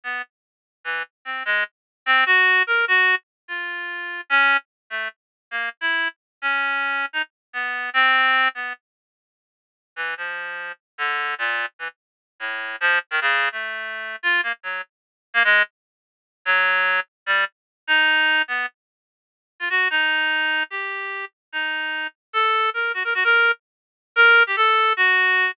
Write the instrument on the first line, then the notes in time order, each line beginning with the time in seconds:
clarinet
0.04 B3
0.84 E3
1.25 C4
1.45 G#3
2.06 C4
2.26 F#4
2.67 A#4
2.88 F#4
3.48 F4
4.30 C#4
4.90 A3
5.51 A#3
5.81 E4
6.42 C#4
7.13 D#4
7.53 B3
7.94 C4
8.55 B3
9.96 E3
10.17 F3
10.98 D3
11.38 A#2
11.79 E3
12.40 A2
12.80 F3
13.11 D#3
13.21 C#3
13.52 A3
14.23 F4
14.43 A#3
14.63 F#3
15.34 A#3
15.44 G#3
16.45 F#3
17.26 G3
17.87 D#4
18.48 B3
19.60 F4
19.70 F#4
19.90 D#4
20.70 G4
21.52 D#4
22.33 A4
22.74 A#4
22.94 F#4
23.04 A#4
23.14 F#4
23.24 A#4
24.16 A#4
24.47 G4
24.56 A4
24.97 F#4